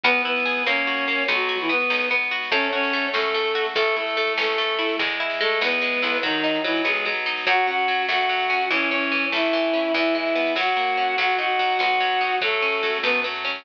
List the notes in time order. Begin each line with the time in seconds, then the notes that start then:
0.04 E2 B3 B4, kick, snare
0.15 snare
0.24 B3 E4 B4, snare
0.36 snare
0.45 G#4, snare
0.57 snare
0.66 F#2 A#3 C#4 C#5, snare
0.76 snare
0.87 F#4, snare
0.97 snare
1.08 A#3, snare
1.18 snare
1.28 B1 F#3 B3 F#4, kick, snare
1.39 snare
1.49 F#4, snare
1.59 E3 E4, snare
1.69 B3 B4, snare
1.80 snare
1.90 B1 D#4, snare
2.00 snare
2.10 B3, snare
2.21 snare
2.31 F#4, snare
2.42 snare
2.51 F#2 A3 C#4 C#5, kick, snare
2.62 snare
2.72 C#4 F#4 C#5, snare
2.83 snare
2.93 A3, snare
3.04 snare
3.13 F#2 A3 C#4 A4, snare
3.25 snare
3.34 A3, snare
3.45 snare
3.55 F#4, snare
3.65 snare
3.75 A1 A3 A4, kick, snare
3.86 snare
3.96 A3 E4 A4, snare
4.07 snare
4.17 A3, snare
4.27 snare
4.38 A1 A3 C#4 A4, snare
4.49 snare
4.58 A3, snare
4.68 snare
4.79 E4, snare
4.89 snare
4.99 E2 G#3, kick, snare
5.09 snare
5.20 E4
5.30 snare
5.41 G#3 A3 A4, snare
5.51 snare
5.61 E2 B3 B4, snare
5.72 snare
5.81 G#3, snare
5.93 snare
6.02 B1 E4, snare
6.13 snare
6.22 D#3 F#3 D#4, kick, snare
6.33 snare
6.44 D#4, snare
6.54 snare
6.64 E3 F#3 E4, snare
6.75 snare
6.84 B1 G#3 B3 G#4, snare
6.95 snare
7.05 F#3, snare
7.16 snare
7.26 D#4, snare
7.37 snare
7.46 F#2 F#3 F#4 F#5, kick, snare
7.57 snare
7.67 C#4 F#4 F#5, snare
7.78 snare
7.88 F#3, snare
7.99 snare
8.08 F#2 A3 F#4 F#5, snare
8.18 snare
8.29 F#3, snare
8.39 snare
8.50 C#4, snare
8.61 snare
8.71 A1 E3 C#4 C#5, kick, snare
8.80 snare
8.90 C#4 C#5, snare
9.01 snare
9.12 E3, snare
9.23 snare
9.32 A1 A3 E4 E5, snare
9.43 snare
9.53 E3, snare
9.63 snare
9.73 C#4, snare
9.84 snare
9.94 E2 E3 E4 E5, kick, snare
10.05 snare
10.15 G#3 E4 E5, snare
10.25 snare
10.35 B3, snare
10.46 snare
10.55 F#2 F#3 F#4 F#5, snare
10.67 snare
10.76 A#3, snare
10.87 snare
10.97 C#4, snare
11.07 snare
11.18 B1 F#3 F#4 F#5, kick, snare
11.29 snare
11.39 D#4 F#4 F#5, snare
11.48 snare
11.59 F#3, snare
11.69 snare
11.79 B1 B3 F#4 F#5, snare
11.90 snare
12.00 F#3, snare
12.11 snare
12.21 D#4, snare
12.31 snare
12.41 F#2 F#3 A3 A4, kick, snare
12.52 snare
12.62 C#4, snare
12.72 snare
12.83 F#3, snare
12.94 snare
13.03 F#2 A3 B3 B4, snare
13.15 snare
13.24 F#3, snare
13.34 snare
13.45 C#4, snare
13.55 snare